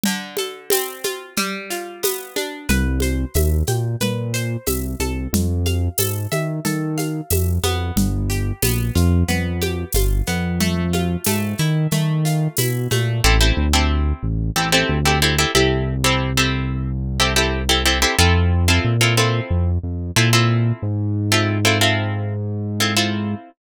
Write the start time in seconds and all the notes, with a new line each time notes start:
0.03 D3, low conga, shaker
0.37 A4, high conga, shaker
0.70 C4, tambourine, high conga, shaker
1.04 F4, high conga, shaker
1.37 G3, low conga, shaker
1.70 F4, shaker
2.03 B3, tambourine, high conga, shaker
2.36 D4, high conga, shaker
2.69 C2 B4, low conga, shaker
3.00 C5, high conga, shaker
3.34 D#2 E5, tambourine, high conga, shaker
3.67 A#2 G5, high conga, shaker
4.00 A#2 B4, low conga, shaker
4.34 C5, shaker
4.66 C2 E5, tambourine, high conga, shaker
5.00 C2 A4, high conga, shaker
5.33 F2, low conga, shaker
5.66 F5, high conga, shaker
5.98 G#2 A4, tambourine, high conga, shaker
6.32 D#3 E5, high conga, shaker
6.65 D#3 A4, low conga, shaker
6.98 F5, high conga, shaker
7.30 F2 E5, tambourine, high conga, shaker
7.63 F2 B3, high conga, shaker
7.96 G1, low conga, shaker
8.30 G4, shaker
8.62 A#1 B3, tambourine, high conga, shaker
8.95 F2 F4, shaker
9.28 F2 B3, low conga, shaker
9.61 G4, high conga, shaker
9.92 G1 F4, tambourine, high conga, shaker
10.27 F2 B3, shaker
10.60 A3, low conga, shaker
10.93 F4, high conga, shaker
11.24 G#2 A3, tambourine, high conga, shaker
11.58 D#3 E4, shaker
11.91 D#3 A3, low conga, shaker
12.25 F4, shaker
12.57 B2 E4, tambourine, high conga, shaker
12.91 A#2 A3, high conga, shaker
13.24 A1 C4 E4 G4 A4
13.41 C4 E4 G4 A4
13.57 D2
13.73 C4 E4 G4 A4
14.23 A1
14.56 A1 C4 E4 G4 A4
14.72 C4 E4 G4 A4
14.89 D2
15.05 C4 E4 G4 A4
15.22 C4 E4 G4 A4
15.38 C4 E4 G4 A4
15.55 C2 C4 E4 G4 A4
16.04 C4 E4 G4 A4
16.37 C4 E4 G4 A4
17.20 C4 E4 G4 A4
17.36 C4 E4 G4 A4
17.69 C4 E4 G4 A4
17.85 C4 E4 G4 A4
18.02 C4 E4 G4 A4
18.19 F2 C4 E4 F4 A4
18.68 C4 E4 F4 A4
18.84 A#2
19.01 C4 E4 F4 A4
19.17 C4 E4 F4 A4
19.50 F2
19.83 F2
20.16 A#2 C4 E4 F4 A4
20.33 C4 E4 F4 A4
20.82 G#2
21.32 C4 E4 F4 A4
21.65 C4 E4 F4 A4
21.81 C4 E4 F4 A4
22.80 C4 E4 F4 A4
22.97 C4 E4 F4 A4